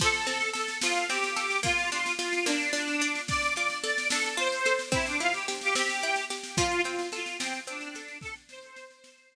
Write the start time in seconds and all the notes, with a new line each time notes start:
0.00 F3 A4, kick, snare, crash
0.14 snare
0.27 C4 A4, snare
0.41 snare
0.53 A4, snare
0.68 snare
0.82 F3 F4, snare
0.95 snare
1.09 C4 G4, snare
1.23 snare
1.36 A4, snare
1.50 snare
1.63 A#3 F4, kick, snare
1.78 snare
1.91 D4 F4, snare
2.06 snare
2.19 F4, snare
2.33 snare
2.46 A#3 D4, snare
2.61 snare
2.73 D4, snare
2.88 snare
3.01 D4, snare
3.15 snare
3.28 D5, kick, snare
3.42 snare
3.55 F4 D5, snare
3.70 snare
3.82 A4 D5, snare
3.98 snare
4.09 D4 A4, snare
4.24 snare
4.37 F4 C5, snare
4.52 snare
4.65 A4, snare
4.79 snare
4.92 C4 E4, kick, snare
5.06 D4, snare
5.20 E4 F4, snare
5.33 G4, snare
5.48 G4, snare
5.61 G4, snare
5.75 C4 G4, snare
5.89 snare
6.03 E4, snare
6.16 snare
6.30 G4, snare
6.43 snare
6.57 F3 F4, kick, snare
6.71 snare
6.83 C4 F4, snare
6.99 snare
7.12 F4 A4, snare
7.26 snare
7.38 F3 C4, snare
7.53 snare
7.67 C4 D4, snare
7.81 snare
7.95 A4, snare
8.08 snare
8.21 A4, kick, snare
8.36 snare
8.49 C5, snare
8.63 snare
8.76 snare
8.91 snare
9.04 snare
9.18 snare
9.32 snare